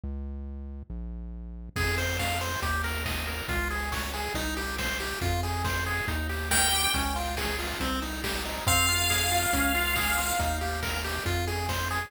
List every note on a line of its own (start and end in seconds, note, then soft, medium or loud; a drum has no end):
0.04 0.83 C#2 medium
0.90 1.69 A#1 medium
1.76 2.56 F2 medium
1.76 1.96 G#4 medium
1.76 kick loud
1.76 crash loud
1.98 2.17 C5 medium
1.98 open hi-hat medium
2.19 2.39 F5 medium
2.19 kick medium
2.19 snare loud
2.41 2.60 C5 medium
2.41 open hi-hat medium
2.62 3.42 D#2 medium
2.62 2.82 G4 medium
2.62 kick medium
2.62 closed hi-hat loud
2.84 3.04 A#4 medium
2.84 open hi-hat medium
3.05 3.25 D#5 medium
3.05 kick medium
3.05 snare loud
3.27 3.47 A#4 medium
3.27 open hi-hat medium
3.48 4.29 C#2 medium
3.48 3.68 F4 medium
3.48 kick loud
3.48 closed hi-hat medium
3.70 3.90 G#4 medium
3.70 open hi-hat medium
3.92 4.11 C#5 medium
3.92 kick medium
3.92 snare loud
4.13 4.33 G#4 medium
4.13 open hi-hat medium
4.34 5.14 C2 medium
4.34 4.55 D#4 loud
4.34 kick medium
4.34 closed hi-hat loud
4.56 4.76 G4 medium
4.56 open hi-hat medium
4.78 4.98 C5 medium
4.78 kick medium
4.78 snare loud
5.00 5.19 G4 medium
5.00 open hi-hat medium
5.21 6.01 F2 medium
5.21 5.41 F4 medium
5.21 kick loud
5.21 closed hi-hat medium
5.43 5.63 G#4 medium
5.43 open hi-hat medium
5.64 5.84 C5 medium
5.64 kick medium
5.64 snare loud
5.86 6.06 G#4 medium
5.86 open hi-hat medium
6.08 6.87 D#2 medium
6.08 6.27 D#4 medium
6.08 kick medium
6.08 closed hi-hat loud
6.29 6.49 G4 medium
6.29 open hi-hat medium
6.51 6.70 A#4 medium
6.51 6.90 G5 medium
6.51 kick medium
6.51 snare loud
6.72 6.92 G4 medium
6.72 open hi-hat medium
6.94 7.74 C#2 medium
6.94 7.14 C#4 medium
6.94 kick loud
6.94 closed hi-hat loud
7.16 7.35 F4 medium
7.16 open hi-hat medium
7.37 7.57 G#4 medium
7.37 kick medium
7.37 snare loud
7.59 7.78 F4 medium
7.59 open hi-hat medium
7.80 8.60 C2 medium
7.80 8.00 C4 medium
7.80 kick medium
7.80 closed hi-hat loud
8.02 8.21 D#4 medium
8.02 open hi-hat medium
8.24 8.43 G4 medium
8.24 kick medium
8.24 snare loud
8.45 8.65 D#4 medium
8.45 open hi-hat medium
8.67 9.46 F2 medium
8.67 8.86 C4 loud
8.67 10.34 F5 medium
8.67 kick loud
8.67 closed hi-hat medium
8.88 9.08 F4 medium
8.88 open hi-hat medium
9.10 9.29 G#4 medium
9.10 kick medium
9.10 snare loud
9.31 9.51 F4 medium
9.31 open hi-hat medium
9.53 10.33 C#2 medium
9.53 9.73 C#4 loud
9.53 kick medium
9.53 closed hi-hat loud
9.74 9.94 F4 medium
9.74 open hi-hat medium
9.96 10.16 G#4 medium
9.96 kick medium
9.96 snare loud
10.18 10.37 F4 medium
10.18 open hi-hat medium
10.39 11.19 D#2 medium
10.39 10.59 D#4 medium
10.39 kick medium
10.39 closed hi-hat loud
10.61 10.80 G4 medium
10.61 open hi-hat medium
10.82 11.02 A#4 medium
10.82 kick medium
10.82 snare loud
11.04 11.24 G4 medium
11.04 open hi-hat medium
11.25 12.05 F2 medium
11.25 11.45 F4 medium
11.25 kick medium
11.25 closed hi-hat medium
11.47 11.67 G#4 medium
11.47 open hi-hat medium
11.69 11.88 C5 medium
11.69 kick medium
11.69 snare loud
11.91 12.10 G#4 medium
11.91 open hi-hat medium